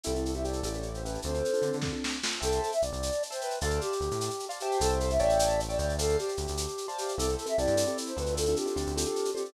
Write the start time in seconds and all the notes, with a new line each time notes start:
0.04 C2 C4 E4 G4 A4, shaker
0.15 C4 E4 G4 A4, shaker
0.25 A4, shaker
0.33 C4 E4 G4 A4 E5, shaker
0.44 C4 E4 G4 A4 D5, shaker
0.53 shaker
0.63 A1 C#4 E4 G4 A4, shaker
0.74 C#4 E4 G4 A4, shaker
0.83 shaker
0.94 C5, shaker
1.04 C#4 E4 G4 A4 B4, shaker
1.14 shaker
1.22 D2 C4 D4 F4 A4 C5, shaker
1.34 C4 D4 F4 A4, shaker
1.45 shaker
1.53 C4 D4 F4 A4, shaker
1.62 D3 C4 D4 F4 A4, shaker
1.73 D3, shaker
1.82 C4 D4 F4 A4, kick, snare
1.93 C4 D4 F4 A4
2.04 snare
2.23 C4 D4 F4 A4, snare
2.41 C2 A4 C5 E5 G5 A5, shaker
2.52 shaker
2.62 A4, shaker
2.72 E5, shaker
2.82 C2 D5, shaker
2.93 C2, shaker
3.03 shaker
3.12 shaker
3.23 shaker
3.30 C5 E5 G5 A5, shaker
3.41 B4, shaker
3.50 shaker
3.61 D2 A4 C5 D5 F5 A5, shaker
3.70 shaker
3.81 G4, shaker
3.92 shaker
4.00 D2, shaker
4.11 A2, shaker
4.21 shaker
4.30 shaker
4.39 shaker
4.49 C5 D5 F5 A5, shaker
4.60 G4 C5 E5 G5 A5, shaker
4.72 shaker
4.80 C2 A4, shaker
4.89 shaker
5.00 A4, shaker
5.10 E5, shaker
5.19 A1 C#5 D5 E5 G5 A5, shaker
5.29 shaker
5.39 shaker
5.50 shaker
5.60 shaker
5.69 C#5 D5 E5 G5 A5, shaker
5.79 D2 D5, shaker
5.89 shaker
5.99 A4 C5 D5 F5 A5, shaker
6.09 shaker
6.19 G4, shaker
6.28 shaker
6.37 D2, shaker
6.47 D2, shaker
6.57 shaker
6.68 shaker
6.78 shaker
6.88 C5 D5 F5 A5, shaker
6.98 G4, shaker
7.08 shaker
7.18 C2 C4 E4 G4 A4, shaker
7.28 C4 E4 G4 A4, shaker
7.37 A4, shaker
7.46 C4 E4 G4 A4 E5, shaker
7.57 C2 C4 E4 G4 A4 D5, shaker
7.67 G2, shaker
7.76 C4 E4 G4 A4, shaker
7.86 C4 E4 G4 A4, shaker
7.98 shaker
8.06 C5, shaker
8.16 D2 C4 D4 F4 A4 B4, shaker
8.26 shaker
8.36 A4, shaker
8.46 C4 D4 F4 A4, shaker
8.56 G4, shaker
8.66 C4 D4 F4 A4, shaker
8.76 D2 C4 D4 F4 A4, shaker
8.86 D2, shaker
8.96 C4 D4 F4 A4, shaker
9.05 C4 D4 F4 A4, shaker
9.16 shaker
9.25 shaker
9.35 C4 D4 F4 G4 A4, shaker
9.45 shaker